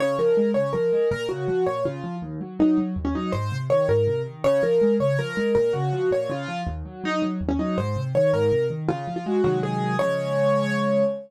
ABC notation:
X:1
M:6/8
L:1/16
Q:3/8=108
K:Db
V:1 name="Acoustic Grand Piano"
d2 B4 d2 B4 | B2 G4 d2 F4 | z4 E2 z3 D E2 | c3 z d2 B4 z2 |
d2 B4 d2 B4 | B2 G4 d2 F4 | z4 E2 z3 D E2 | c3 z d2 B4 z2 |
F3 F G2 G2 A4 | d12 |]
V:2 name="Acoustic Grand Piano" clef=bass
D,2 F,2 A,2 D,2 F,2 A,2 | B,,2 D,2 F,2 B,,2 D,2 F,2 | E,,2 G,2 G,2 G,2 E,,2 G,2 | A,,2 C,2 E,2 A,,2 C,2 E,2 |
D,2 F,2 A,2 D,2 F,2 A,2 | B,,2 D,2 F,2 B,,2 D,2 F,2 | E,,2 G,2 G,2 G,2 E,,2 G,2 | A,,2 C,2 E,2 A,,2 C,2 E,2 |
D,2 F,2 A,2 [C,E,G,A,]6 | [D,F,A,]12 |]